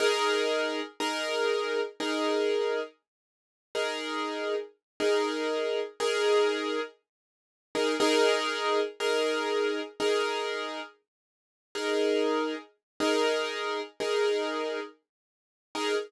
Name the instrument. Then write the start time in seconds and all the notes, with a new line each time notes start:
acoustic grand piano
0.00 D#4 G#4 A#4
1.00 D#4 G#4 A#4
2.00 D#4 G#4 A#4
3.75 D#4 G#4 A#4
5.00 D#4 G#4 A#4
6.00 D#4 G#4 A#4
7.75 D#4 G#4 A#4
8.00 D#4 G#4 A#4
9.00 D#4 G#4 A#4
10.00 D#4 G#4 A#4
11.75 D#4 G#4 A#4
13.00 D#4 G#4 A#4
14.00 D#4 G#4 A#4
15.75 D#4 G#4 A#4